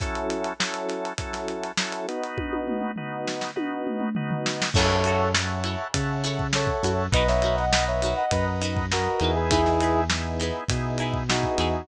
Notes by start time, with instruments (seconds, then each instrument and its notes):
0.00 drawbar organ F#3 C#4 E4 A4, kick, closed hi-hat
0.15 closed hi-hat
0.30 closed hi-hat
0.44 closed hi-hat
0.60 drawbar organ F#3 C#4 E4 A4, snare
0.74 closed hi-hat
0.89 snare, closed hi-hat
1.05 closed hi-hat
1.18 drawbar organ F#3 C#4 E4 A4, kick, closed hi-hat
1.33 snare, closed hi-hat
1.48 closed hi-hat
1.63 closed hi-hat
1.77 drawbar organ F#3 C#4 E4 A4, snare
1.92 closed hi-hat
2.08 drawbar organ B3 D#4 F#4, closed hi-hat
2.24 closed hi-hat
2.38 kick, high tom
2.53 high tom
2.68 mid tom
2.81 mid tom
2.96 drawbar organ B3 D#4 F#4, floor tom
3.27 snare
3.41 snare
3.56 drawbar organ B3 D#4 F#4, high tom
3.87 mid tom
4.00 mid tom
4.15 drawbar organ B3 D#4 F#4, floor tom
4.31 floor tom
4.46 snare
4.62 snare
4.74 synth bass 1 F#2, pizzicato strings E4 F#4 A4, brass section A4 C#5, drawbar organ C#5 E5 F#5 A5, kick, crash
4.78 pizzicato strings C#5
4.90 snare
5.04 pizzicato strings E4 F#4 A4, closed hi-hat
5.08 pizzicato strings C#5
5.34 drawbar organ C#5 E5 F#5 A5, snare
5.64 pizzicato strings E4 F#4 A4 C#5, closed hi-hat
5.94 synth bass 1 C#3, drawbar organ C#5 E5 F#5 A5, kick, closed hi-hat
6.24 pizzicato strings E4 F#4 A4 C#5, snare, closed hi-hat
6.39 kick
6.53 brass section A4 C#5, drawbar organ C#5 E5 F#5 A5, snare
6.67 kick
6.83 synth bass 1 F#2, pizzicato strings E4 F#4 A4 C#5, closed hi-hat
7.12 synth bass 1 B1, pizzicato strings D#4 F#4 A#4, drawbar organ B4 D#5 F#5 A#5, brass section B4 D#5, kick, closed hi-hat
7.16 pizzicato strings B4
7.28 brass section C#5 E5, snare
7.42 pizzicato strings D#4 F#4 A#4, closed hi-hat
7.46 pizzicato strings B4
7.58 brass section D#5 F#5, snare
7.72 drawbar organ B4 D#5 F#5 A#5, snare
7.87 brass section C#5 E5
8.02 pizzicato strings D#4 F#4 A#4 B4, closed hi-hat
8.17 brass section D#5 F#5
8.31 synth bass 1 F#2, brass section B4 D#5, drawbar organ B4 D#5 F#5 A#5, kick, closed hi-hat
8.61 pizzicato strings D#4 F#4 A#4 B4, closed hi-hat
8.76 kick
8.91 brass section F#4 A#4, drawbar organ B4 D#5 F#5 A#5, snare
9.20 synth bass 1 E2, drawbar organ B3 D#4 E4 G#4, pizzicato strings D#4 F#4 A#4, closed hi-hat
9.24 pizzicato strings B4
9.35 brass section G#4 B4
9.50 pizzicato strings D#4 E4 G#4, brass section E4 G#4, kick, closed hi-hat
9.54 pizzicato strings B4
9.66 snare
9.80 pizzicato strings D#4 E4 G#4 B4, closed hi-hat
10.10 drawbar organ B3 D#4 E4 G#4, snare
10.40 pizzicato strings D#4 E4 G#4 B4, closed hi-hat
10.68 synth bass 1 B2, drawbar organ B3 D#4 E4 G#4, kick, closed hi-hat
10.98 pizzicato strings D#4 E4 G#4, closed hi-hat
11.02 pizzicato strings B4
11.14 kick
11.29 drawbar organ B3 D#4 E4 G#4, brass section D#4 F#4, snare
11.43 kick
11.58 synth bass 1 E2, pizzicato strings D#4 E4 G#4 B4, closed hi-hat